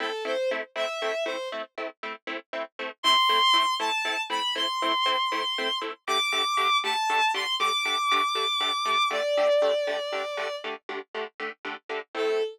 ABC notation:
X:1
M:12/8
L:1/8
Q:3/8=79
K:Ador
V:1 name="Violin"
A c z e2 c z6 | c'3 a2 b c'6 | d'3 a2 c' d'6 | d7 z5 |
A3 z9 |]
V:2 name="Pizzicato Strings"
[A,CE] [A,CE] [A,CE] [A,CE] [A,CE] [A,CE] [A,CE] [A,CE] [A,CE] [A,CE] [A,CE] [A,CE] | [A,CE] [A,CE] [A,CE] [A,CE] [A,CE] [A,CE] [A,CE] [A,CE] [A,CE] [A,CE] [A,CE] [A,CE] | [D,A,G] [D,A,G] [D,A,G] [D,A,G] [D,A,G] [D,A,G] [D,A,G] [D,A,G] [D,A,G] [D,A,G] [D,A,G] [D,A,G] | [D,A,G] [D,A,G] [D,A,G] [D,A,G] [D,A,G] [D,A,G] [D,A,G] [D,A,G] [D,A,G] [D,A,G] [D,A,G] [D,A,G] |
[A,CE]3 z9 |]